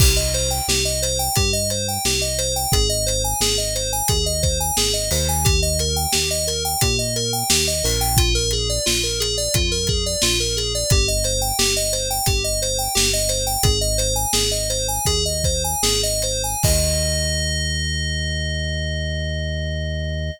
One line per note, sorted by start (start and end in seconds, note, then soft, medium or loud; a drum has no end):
0.00 0.61 C2 medium
0.00 0.16 G4 loud
0.00 kick loud
0.00 crash loud
0.16 0.32 D#5 medium
0.34 0.50 C5 medium
0.34 closed hi-hat medium
0.51 0.66 G5 medium
0.68 1.29 C2 medium
0.68 0.84 G4 loud
0.68 snare loud
0.85 1.01 D#5 medium
1.02 1.18 C5 medium
1.02 closed hi-hat medium
1.19 1.35 G5 medium
1.36 1.98 G2 medium
1.36 1.52 G4 loud
1.36 kick loud
1.36 closed hi-hat loud
1.53 1.69 D#5 medium
1.70 1.87 C5 medium
1.70 closed hi-hat medium
1.88 2.04 G5 medium
2.05 2.66 C2 medium
2.05 2.21 G4 medium
2.05 snare loud
2.21 2.37 D#5 medium
2.38 2.54 C5 medium
2.38 closed hi-hat medium
2.56 2.72 G5 medium
2.72 3.34 G#1 medium
2.72 2.88 G#4 loud
2.72 kick loud
2.72 closed hi-hat loud
2.89 3.05 D#5 medium
3.06 3.22 C5 medium
3.06 closed hi-hat medium
3.24 3.40 G#5 medium
3.40 4.02 G#1 medium
3.40 3.57 G#4 loud
3.40 snare loud
3.58 3.74 D#5 medium
3.75 3.91 C5 medium
3.75 closed hi-hat medium
3.93 4.08 G#5 medium
4.08 4.71 D#2 medium
4.08 4.25 G#4 medium
4.08 kick loud
4.08 closed hi-hat loud
4.26 4.42 D#5 medium
4.43 4.58 C5 medium
4.43 kick medium
4.43 closed hi-hat medium
4.60 4.76 G#5 medium
4.77 5.10 G#1 medium
4.77 4.93 G#4 loud
4.77 snare loud
4.93 5.09 D#5 medium
5.11 6.07 D#2 loud
5.11 5.27 C5 medium
5.11 open hi-hat medium
5.29 5.44 G#5 medium
5.45 5.60 G4 loud
5.45 kick loud
5.45 closed hi-hat loud
5.62 5.78 D#5 medium
5.79 5.96 A#4 medium
5.79 closed hi-hat medium
5.96 6.12 G5 medium
6.12 6.76 D#2 medium
6.12 6.28 G4 medium
6.12 snare loud
6.31 6.46 D#5 medium
6.47 6.63 A#4 medium
6.47 closed hi-hat medium
6.65 6.80 G5 medium
6.81 7.43 A#2 medium
6.81 6.97 G4 loud
6.81 kick loud
6.81 closed hi-hat loud
6.99 7.14 D#5 medium
7.16 7.32 A#4 medium
7.16 closed hi-hat medium
7.33 7.49 G5 medium
7.50 7.82 D#2 medium
7.50 7.66 G4 medium
7.50 snare loud
7.68 7.83 D#5 medium
7.84 8.79 A#1 loud
7.84 8.00 A#4 medium
7.84 open hi-hat medium
8.01 8.16 G5 loud
8.17 8.34 F4 loud
8.17 kick loud
8.17 closed hi-hat loud
8.35 8.51 A#4 loud
8.51 8.68 G#4 medium
8.51 closed hi-hat medium
8.69 8.85 D5 medium
8.86 9.48 A#1 medium
8.86 9.02 F4 medium
8.86 snare loud
9.03 9.19 A#4 medium
9.20 9.36 G#4 medium
9.20 closed hi-hat loud
9.37 9.53 D5 medium
9.54 10.16 F2 medium
9.54 9.70 F4 medium
9.54 kick loud
9.54 closed hi-hat loud
9.72 9.87 A#4 medium
9.87 10.04 G#4 medium
9.87 kick loud
9.87 closed hi-hat medium
10.06 10.22 D5 medium
10.22 10.84 A#1 medium
10.22 10.38 F4 loud
10.22 snare loud
10.40 10.56 A#4 medium
10.57 10.73 G#4 medium
10.57 closed hi-hat medium
10.75 10.90 D5 medium
10.90 11.52 G1 medium
10.90 11.07 G4 loud
10.90 kick loud
10.90 closed hi-hat loud
11.08 11.24 D#5 medium
11.24 11.40 C5 medium
11.24 closed hi-hat medium
11.41 11.57 G5 medium
11.59 12.20 G1 medium
11.59 11.74 G4 loud
11.59 snare loud
11.77 11.92 D#5 medium
11.93 12.08 C5 medium
11.93 closed hi-hat medium
12.10 12.26 G5 medium
12.26 12.88 G1 medium
12.26 12.43 G4 medium
12.26 kick loud
12.26 closed hi-hat loud
12.44 12.60 D#5 medium
12.62 12.78 C5 medium
12.62 closed hi-hat medium
12.79 12.94 G5 medium
12.95 13.57 G1 medium
12.95 13.11 G4 loud
12.95 snare loud
13.13 13.29 D#5 medium
13.29 13.45 C5 medium
13.29 closed hi-hat medium
13.47 13.62 G5 medium
13.63 14.26 G#1 loud
13.63 13.79 G#4 loud
13.63 kick loud
13.63 closed hi-hat loud
13.81 13.97 D#5 medium
13.98 14.14 C5 medium
13.98 closed hi-hat medium
14.16 14.32 G#5 medium
14.33 14.99 G#1 medium
14.33 14.50 G#4 loud
14.33 snare loud
14.51 14.68 D#5 medium
14.70 14.87 C5 medium
14.70 closed hi-hat medium
14.88 15.05 G#5 medium
15.06 15.75 D#2 medium
15.06 15.24 G#4 loud
15.06 kick medium
15.06 closed hi-hat loud
15.25 15.43 D#5 medium
15.44 15.63 C5 medium
15.44 kick medium
15.44 closed hi-hat medium
15.64 15.82 G#5 medium
15.83 16.55 G#1 medium
15.83 16.01 G#4 loud
15.83 snare loud
16.03 16.22 D#5 medium
16.22 16.42 C5 medium
16.22 closed hi-hat medium
16.44 16.63 G#5 medium
16.63 20.31 D#2 loud
16.63 20.31 D#5 loud
16.63 kick loud
16.63 crash loud